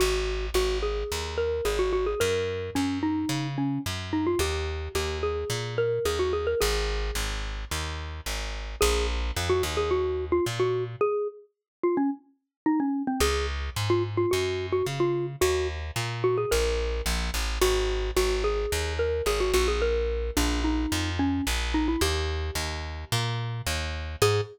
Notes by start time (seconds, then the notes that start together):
0.00 G#1 F#4
0.54 G#1 F#4
0.83 G#4
1.12 D#2
1.38 A#4
1.65 G#1 G#4
1.79 F#4
1.93 F#4
2.06 G#4
2.20 F#2 A#4
2.75 F#2 C#4
3.03 D#4
3.29 C#3
3.58 C#4
3.86 F#2
4.13 D#4
4.27 F4
4.39 D#2 G4
4.95 D#2 G4
5.23 G#4
5.50 A#2
5.78 A#4
6.05 D#2 G#4
6.19 F#4
6.33 G#4
6.47 A#4
6.61 G#1 G#4
7.15 G#1
7.71 D#2
8.26 G#1
8.81 A#1 G#4
9.36 F2
9.50 F#4
9.63 D#2
9.77 G#4
9.91 F#4
10.32 F4
10.46 A#2
10.60 F#4
11.01 G#4
11.83 F4
11.97 C#4
12.66 D#4
12.80 C#4
13.07 C4
13.20 C#2 G#4
13.76 G#2
13.90 F4
14.17 F4
14.31 F#2 F#4
14.72 F#4
14.86 C#3
15.00 F4
15.41 D#2 F#4
15.96 A#2
16.24 F#4
16.38 G#4
16.51 A#1 A#4
17.06 A#1
17.34 A1
17.61 G#1 F#4
18.17 G#1 F#4
18.44 G#4
18.72 D#2
18.99 A#4
19.26 G#1 G#4
19.40 F#4
19.54 A#1 F#4
19.68 G#4
19.82 A#4
20.37 A#1 D4
20.64 D#4
20.92 F2
21.19 C#4
21.47 A#1
21.74 D#4
21.88 E4
22.01 D#2 G4
22.55 D#2
23.12 A#2
23.67 D#2
24.22 G#2 G#4